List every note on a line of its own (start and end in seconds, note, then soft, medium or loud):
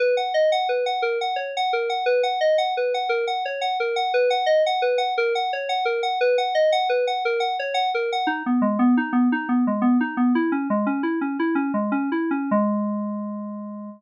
0.00 0.15 B4 medium
0.17 0.33 F#5 medium
0.34 0.50 D#5 medium
0.52 0.68 F#5 medium
0.69 0.85 B4 medium
0.86 1.02 F#5 medium
1.02 1.18 A#4 medium
1.21 1.37 F#5 medium
1.36 1.52 C#5 medium
1.57 1.73 F#5 medium
1.73 1.89 A#4 medium
1.90 2.05 F#5 medium
2.06 2.22 B4 medium
2.23 2.39 F#5 medium
2.41 2.57 D#5 medium
2.58 2.74 F#5 medium
2.77 2.93 B4 medium
2.94 3.10 F#5 medium
3.09 3.25 A#4 medium
3.27 3.43 F#5 medium
3.45 3.61 C#5 medium
3.61 3.77 F#5 medium
3.80 3.96 A#4 medium
3.96 4.12 F#5 medium
4.14 4.30 B4 medium
4.30 4.46 F#5 medium
4.46 4.62 D#5 medium
4.66 4.82 F#5 medium
4.82 4.98 B4 medium
4.98 5.14 F#5 medium
5.18 5.33 A#4 medium
5.35 5.51 F#5 medium
5.53 5.69 C#5 medium
5.69 5.85 F#5 medium
5.85 6.01 A#4 medium
6.03 6.19 F#5 medium
6.21 6.37 B4 medium
6.38 6.54 F#5 medium
6.55 6.71 D#5 medium
6.72 6.88 F#5 medium
6.89 7.05 B4 medium
7.07 7.23 F#5 medium
7.25 7.41 A#4 medium
7.40 7.56 F#5 medium
7.59 7.75 C#5 medium
7.74 7.90 F#5 medium
7.94 8.10 A#4 medium
8.12 8.28 F#5 medium
8.27 8.43 D#4 medium
8.46 8.62 B3 medium
8.62 8.78 G#3 medium
8.79 8.95 B3 medium
8.97 9.13 D#4 medium
9.13 9.29 B3 medium
9.32 9.48 D#4 medium
9.49 9.65 B3 medium
9.67 9.83 G#3 medium
9.82 9.97 B3 medium
10.01 10.16 D#4 medium
10.17 10.33 B3 medium
10.35 10.51 E4 medium
10.52 10.68 C#4 medium
10.70 10.86 G#3 medium
10.86 11.02 C#4 medium
11.03 11.19 E4 medium
11.21 11.37 C#4 medium
11.39 11.56 E4 medium
11.55 11.72 C#4 medium
11.74 11.91 G#3 medium
11.92 12.10 C#4 medium
12.12 12.30 E4 medium
12.31 12.50 C#4 medium
12.51 13.90 G#3 loud